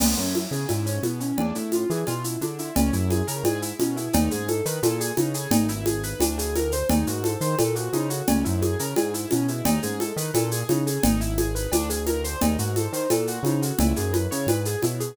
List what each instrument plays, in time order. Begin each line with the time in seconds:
0.00 synth bass 1 C#2, acoustic grand piano B3, crash, cowbell, low conga, shaker
0.17 synth bass 1 F#2, acoustic grand piano C#4, shaker
0.35 acoustic grand piano E4, high conga, shaker
0.51 synth bass 1 C#3, acoustic grand piano G#4, shaker
0.68 synth bass 1 G#2, acoustic grand piano E4, cowbell, high conga, shaker
0.86 acoustic grand piano C#4, shaker
1.03 synth bass 1 B2, acoustic grand piano B3, high conga, shaker
1.20 acoustic grand piano C#4, shaker
1.38 synth bass 1 E2, acoustic grand piano D4, cowbell, low conga
1.55 synth bass 1 A2, acoustic grand piano E4, shaker
1.72 acoustic grand piano F4, high conga, shaker
1.90 synth bass 1 E3, acoustic grand piano G#4, shaker
2.07 synth bass 1 B2, acoustic grand piano F4, cowbell, high conga, shaker
2.24 acoustic grand piano E4, shaker
2.41 synth bass 1 D3, acoustic grand piano D4, high conga, shaker
2.59 acoustic grand piano E4, shaker
2.75 synth bass 1 C#2, acoustic grand piano C#4, cowbell, low conga, shaker
2.93 synth bass 1 F#2, acoustic grand piano E4, shaker
3.10 acoustic grand piano G#4, high conga, shaker
3.27 synth bass 1 C#3, acoustic grand piano A#4, shaker
3.43 synth bass 1 G#2, acoustic grand piano G#4, cowbell, high conga, shaker
3.62 acoustic grand piano E4, shaker
3.79 synth bass 1 B2, acoustic grand piano C#4, high conga, shaker
3.97 acoustic grand piano E4, shaker
4.13 synth bass 1 D#2, acoustic grand piano D#4, cowbell, low conga, shaker
4.31 synth bass 1 G#2, acoustic grand piano G#4, shaker
4.48 acoustic grand piano A4, high conga, shaker
4.65 synth bass 1 D#3, acoustic grand piano B4, shaker
4.83 synth bass 1 A#2, acoustic grand piano A4, cowbell, high conga, shaker
5.00 acoustic grand piano G#4, shaker
5.17 synth bass 1 C#3, acoustic grand piano D#4, high conga, shaker
5.34 acoustic grand piano G#4, shaker
5.51 synth bass 1 G#1, acoustic grand piano D#4, cowbell, low conga, shaker
5.68 acoustic grand piano E4, shaker
5.86 acoustic grand piano G#4, high conga, shaker
6.03 acoustic grand piano B4, shaker
6.20 synth bass 1 D2, acoustic grand piano D4, cowbell, high conga, shaker
6.38 acoustic grand piano G#4, shaker
6.55 acoustic grand piano A#4, high conga, shaker
6.72 acoustic grand piano C5, shaker
6.89 synth bass 1 D#2, acoustic grand piano D#4, cowbell, low conga, shaker
7.07 synth bass 1 G#2, acoustic grand piano F#4, shaker
7.24 acoustic grand piano A4, high conga, shaker
7.41 synth bass 1 D#3, acoustic grand piano C5, shaker
7.58 synth bass 1 A#2, acoustic grand piano A4, cowbell, high conga, shaker
7.75 acoustic grand piano F#4, shaker
7.93 synth bass 1 C#3, acoustic grand piano D#4, high conga, shaker
8.10 acoustic grand piano F#4, shaker
8.27 synth bass 1 C#2, acoustic grand piano C#4, cowbell, low conga, shaker
8.44 synth bass 1 F#2, acoustic grand piano E4, shaker
8.62 acoustic grand piano G#4, high conga, shaker
8.79 synth bass 1 C#3, acoustic grand piano A#4, shaker
8.96 synth bass 1 G#2, acoustic grand piano G#4, cowbell, high conga, shaker
9.14 acoustic grand piano E4, shaker
9.31 synth bass 1 B2, acoustic grand piano C#4, high conga, shaker
9.48 acoustic grand piano E4, shaker
9.65 synth bass 1 D#2, acoustic grand piano D#4, cowbell, low conga, shaker
9.83 synth bass 1 G#2, acoustic grand piano G#4, shaker
10.00 acoustic grand piano A4, high conga, shaker
10.16 synth bass 1 D#3, acoustic grand piano B4, shaker
10.34 synth bass 1 A#2, acoustic grand piano A4, cowbell, high conga, shaker
10.51 acoustic grand piano G#4, shaker
10.69 synth bass 1 C#3, acoustic grand piano D#4, high conga, shaker
10.87 acoustic grand piano G#4, shaker
11.03 synth bass 1 G#1, acoustic grand piano D#4, cowbell, low conga, shaker
11.21 acoustic grand piano E4, shaker
11.38 acoustic grand piano G#4, high conga, shaker
11.55 acoustic grand piano B4, shaker
11.72 synth bass 1 D2, acoustic grand piano D4, cowbell, high conga, shaker
11.90 acoustic grand piano G#4, shaker
12.06 acoustic grand piano A#4, high conga, shaker
12.24 acoustic grand piano C5, shaker
12.41 synth bass 1 D#2, acoustic grand piano D#4, cowbell, low conga, shaker
12.59 synth bass 1 G#2, acoustic grand piano F#4, shaker
12.76 acoustic grand piano A4, high conga, shaker
12.93 synth bass 1 D#3, acoustic grand piano C5, shaker
13.10 synth bass 1 A#2, acoustic grand piano A4, cowbell, high conga, shaker
13.27 acoustic grand piano F#4, shaker
13.43 synth bass 1 C#3, acoustic grand piano D#4, high conga, shaker
13.62 acoustic grand piano F#4, shaker
13.79 synth bass 1 C#2, acoustic grand piano E4, cowbell, low conga, shaker
13.96 synth bass 1 F#2, acoustic grand piano G#4, shaker
14.13 acoustic grand piano B4, high conga, shaker
14.31 synth bass 1 C#3, acoustic grand piano C#5, shaker
14.47 synth bass 1 G#2, acoustic grand piano B4, cowbell, high conga, shaker
14.65 acoustic grand piano G#4, shaker
14.82 synth bass 1 B2, acoustic grand piano E4, high conga, shaker
15.00 acoustic grand piano G#4, shaker